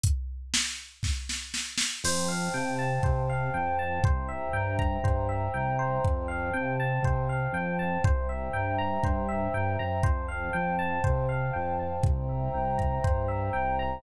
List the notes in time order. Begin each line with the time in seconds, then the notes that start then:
0.04 kick, closed hi-hat
0.54 snare
1.03 kick, snare
1.29 snare
1.54 snare
1.78 snare
2.04 F2 C5 F5 G5 A5, crash
2.28 F5
2.54 C3 G5
2.79 A5
3.03 C3 C5, kick
3.29 F5
3.54 F2 G5
3.79 A5
4.03 C2 C5 E5 G5 A#5, kick
4.29 E5
4.53 G2 G5
4.79 A#5, kick
5.03 G2 C5, kick
5.29 E5
5.54 C2 G5
5.79 C5
6.04 F2 C5 F5 G5 A5, kick
6.28 F5
6.54 C3 G5
6.80 A5
7.03 C3 C5, kick
7.29 F5
7.53 F2 G5
7.79 A5
8.04 C2 C5 E5 G5 A#5, kick
8.29 E5
8.53 G2 G5
8.78 A#5
9.03 G2 C5, kick
9.29 E5
9.54 G2 G5
9.79 F#2 A#5
10.03 F2 C5 F5 G5 A5, kick
10.28 F5
10.53 F2 G5
10.79 A5
11.04 C3 C5, kick
11.29 F5
11.53 F2 G5
11.79 A5
12.03 C2 C5 E5 G5 A#5, kick
12.29 E5
12.54 C2 G5
12.78 A#5, kick
13.04 G2 C5, kick
13.28 E5
13.53 C2 G5
13.79 A#5